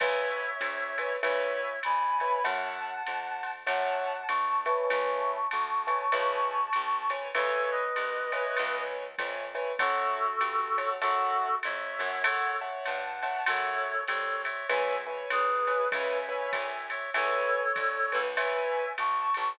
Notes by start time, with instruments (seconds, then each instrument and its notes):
0.00 electric bass (finger) C#2, acoustic grand piano B4 C#5 E5 G#5, clarinet C#5 E5, kick, crash, ride
0.61 electric bass (finger) D2, hi-hat pedal, ride
0.98 acoustic grand piano B4 C#5 E5 G#5, ride
1.22 electric bass (finger) C#2, acoustic grand piano B4 C#5 E5 G#5, clarinet C#5 E5, ride
1.83 electric bass (finger) F2, clarinet G#5 B5, hi-hat pedal, ride
2.20 acoustic grand piano B4 C#5 E5 G#5, ride
2.44 electric bass (finger) F#2, acoustic grand piano C#5 E5 F#5 A5, clarinet F#5 A5, ride
3.07 electric bass (finger) F2, hi-hat pedal, ride
3.43 ride
3.66 electric bass (finger) F#2, acoustic grand piano C#5 E5 F#5 A5, clarinet F#5 A5, ride
4.28 electric bass (finger) D2, clarinet A5 C#6, hi-hat pedal, ride
4.66 acoustic grand piano B4 C#5 E5 G#5, ride
4.90 electric bass (finger) C#2, clarinet A5 C#6, ride
5.51 electric bass (finger) D2, hi-hat pedal, ride
5.87 acoustic grand piano B4 C#5 E5 G#5, ride
6.12 electric bass (finger) C#2, acoustic grand piano B4 C#5 E5 G#5, ride
6.73 electric bass (finger) C2, hi-hat pedal, ride
7.10 acoustic grand piano B4 C#5 E5 G#5, ride
7.35 electric bass (finger) C#2, clarinet A4 C#5, acoustic grand piano B4 C#5 E5 G#5, ride
7.71 clarinet B4 D#5
7.96 electric bass (finger) C2, hi-hat pedal, ride
8.32 acoustic grand piano B4 C#5 E5 G#5, ride
8.57 electric bass (finger) C#2, ride
9.18 electric bass (finger) F2, acoustic grand piano B4 C#5 E5 G#5, kick, hi-hat pedal, ride
9.55 acoustic grand piano B4 C#5 E5 G#5, ride
9.79 electric bass (finger) F#2, clarinet F#4 A4, acoustic grand piano C#5 E5 F#5 A5, kick, ride
10.41 electric bass (finger) G2, hi-hat pedal, ride
10.78 acoustic grand piano C#5 E5 F#5 A5, ride
11.01 electric bass (finger) F#2, clarinet F#4 A4, acoustic grand piano C#5 E5 F#5 A5, ride
11.63 electric bass (finger) F2, clarinet C#5 E5, hi-hat pedal, ride
11.99 electric bass (finger) F#2, acoustic grand piano C#5 E5 F#5 A5, ride
12.24 clarinet A4 C#5, acoustic grand piano C#5 E5 F#5 A5, ride
12.61 acoustic grand piano C#5 E5 F#5 A5
12.85 electric bass (finger) G2, clarinet F#5 A5, hi-hat pedal, ride
13.22 acoustic grand piano C#5 E5 F#5 A5, ride
13.46 electric bass (finger) F#2, clarinet A4 C#5, acoustic grand piano C#5 E5 F#5 A5, ride
14.08 electric bass (finger) C2, clarinet A4 C#5, hi-hat pedal, ride
14.44 clarinet C#5 E5, ride
14.69 electric bass (finger) C#2, acoustic grand piano B4 C#5 E5 G#5, clarinet E5 G#5, ride
15.07 acoustic grand piano B4 C#5 E5 G#5
15.30 electric bass (finger) D2, clarinet G#4 B4, hi-hat pedal, ride
15.67 acoustic grand piano B4 C#5 E5 G#5, ride
15.92 electric bass (finger) C#2, acoustic grand piano B4 C#5 E5 G#5, clarinet E5 G#5, kick, ride
16.29 acoustic grand piano B4 C#5 E5 G#5
16.52 electric bass (finger) C2, clarinet E5 G#5, kick, hi-hat pedal, ride
16.90 clarinet C#5 E5, ride
17.14 electric bass (finger) C#2, clarinet A4 C#5, acoustic grand piano B4 C#5 E5 G#5, ride
17.76 electric bass (finger) D2, kick, hi-hat pedal, ride
18.12 electric bass (finger) C#2, acoustic grand piano B4 C#5 E5 G#5, ride
18.37 acoustic grand piano B4 C#5 E5 G#5, clarinet E5 G#5, ride
18.98 electric bass (finger) B1, clarinet A5 C#6, hi-hat pedal, ride
19.34 electric bass (finger) A#1, ride